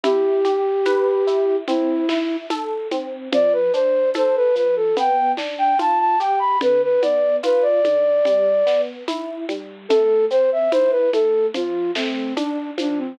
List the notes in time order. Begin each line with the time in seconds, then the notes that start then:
0.03 E4 G4, low conga, shaker
0.45 G4, high conga, shaker
0.85 B4, tambourine, high conga, shaker
1.27 E4, shaker
1.67 C4 E4, low conga, shaker
2.09 E4, snare, high conga, shaker
2.50 A4, tambourine, high conga, shaker
2.91 C4, high conga, shaker
3.32 F3 D5, low conga, shaker
3.53 B4
3.73 D4 C5, shaker
4.14 A4 C5, tambourine, high conga, shaker
4.36 B4
4.55 F3 B4, shaker
4.76 A4
4.97 B3 G5, low conga, shaker
5.37 D4, snare, high conga, shaker
5.58 G5
5.79 F4 A5, tambourine, high conga, shaker
5.99 A5
6.20 G4 G5, shaker
6.39 B5
6.61 D3 B4, low conga, shaker
6.83 B4
7.02 B3 D5, high conga, shaker
7.43 F4 B4, tambourine, high conga, shaker
7.62 D5
7.84 D3, high conga, shaker
8.25 G3, low conga, shaker
8.66 B3, snare, shaker
9.08 E4, tambourine, high conga, shaker
9.49 G3, high conga, shaker
9.89 A3 A4, low conga, shaker
10.30 C4 C5, shaker
10.52 E5
10.71 E4 C5, tambourine, high conga, shaker
10.91 B4
11.13 A3 A4, high conga, shaker
11.54 F3 F4, low conga, shaker
11.95 A3 C4, snare, shaker
12.36 D4, tambourine, high conga, shaker
12.78 F3 D4, high conga, shaker
12.98 C4